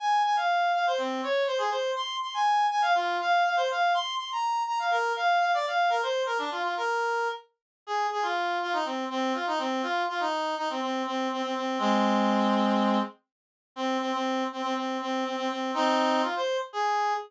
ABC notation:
X:1
M:4/4
L:1/16
Q:1/4=122
K:Fdor
V:1 name="Clarinet"
a2 a f3 f c C2 _d2 c A c2 | c'2 c' a3 a f F2 f2 f c f2 | c'2 c' b3 b f B2 f2 f d f2 | B c2 B D F F B5 z4 |
A2 A F3 F E C2 C2 F E C2 | F2 F E3 E C C2 C2 C C C2 | [A,C]12 z4 | C2 C C3 C C C2 C2 C C C2 |
[CE]4 F c2 z A4 z4 |]